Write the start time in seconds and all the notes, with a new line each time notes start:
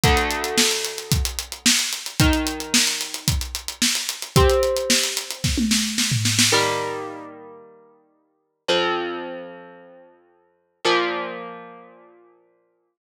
0.03 D2 D3 A3, kick, closed hi-hat
0.17 closed hi-hat
0.31 closed hi-hat
0.44 closed hi-hat
0.58 snare
0.71 closed hi-hat
0.85 closed hi-hat
0.98 closed hi-hat
1.12 kick, closed hi-hat
1.25 closed hi-hat
1.39 closed hi-hat
1.52 closed hi-hat
1.66 snare
1.79 closed hi-hat
1.93 closed hi-hat
2.06 closed hi-hat
2.20 D#3 D#4 A#4, kick, closed hi-hat
2.33 closed hi-hat
2.47 closed hi-hat
2.60 closed hi-hat
2.74 snare
2.87 closed hi-hat
3.01 closed hi-hat
3.14 closed hi-hat
3.28 kick, closed hi-hat
3.41 closed hi-hat
3.55 closed hi-hat
3.68 closed hi-hat
3.82 snare
3.95 closed hi-hat
4.09 closed hi-hat
4.22 closed hi-hat
4.36 C4 G4 C5, kick, closed hi-hat
4.50 closed hi-hat
4.63 closed hi-hat
4.77 closed hi-hat
4.90 snare
5.03 closed hi-hat
5.17 closed hi-hat
5.31 closed hi-hat
5.44 kick, snare
5.58 high tom
5.71 snare
5.98 snare
6.11 floor tom
6.25 snare
6.39 snare
6.52 D#3 G3 A#3
8.68 F2 F3 C4
10.85 A#2 F3 A#3